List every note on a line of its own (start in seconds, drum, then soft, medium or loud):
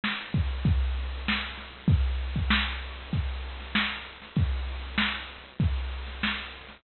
0.04 snare loud
0.18 closed hi-hat medium
0.34 kick loud
0.34 closed hi-hat medium
0.49 closed hi-hat medium
0.65 kick loud
0.65 closed hi-hat loud
0.80 closed hi-hat medium
0.95 closed hi-hat medium
1.12 closed hi-hat medium
1.28 snare loud
1.43 closed hi-hat medium
1.58 snare soft
1.58 closed hi-hat medium
1.73 closed hi-hat medium
1.88 kick loud
1.88 closed hi-hat loud
2.05 closed hi-hat medium
2.19 closed hi-hat medium
2.36 kick medium
2.36 closed hi-hat medium
2.50 snare loud
2.67 closed hi-hat medium
2.82 closed hi-hat loud
2.97 closed hi-hat medium
3.13 kick medium
3.13 closed hi-hat loud
3.29 closed hi-hat medium
3.44 closed hi-hat medium
3.60 snare soft
3.60 closed hi-hat medium
3.75 snare loud
4.07 closed hi-hat medium
4.22 snare soft
4.22 closed hi-hat medium
4.36 kick loud
4.36 closed hi-hat loud
4.52 closed hi-hat medium
4.68 closed hi-hat medium
4.83 closed hi-hat medium
4.98 snare loud
5.14 closed hi-hat medium
5.30 closed hi-hat medium
5.45 closed hi-hat medium
5.60 kick loud
5.60 closed hi-hat loud
5.76 closed hi-hat medium
5.92 closed hi-hat medium
6.06 snare soft
6.06 closed hi-hat medium
6.23 snare loud
6.38 closed hi-hat medium
6.54 closed hi-hat medium
6.67 snare soft
6.67 closed hi-hat medium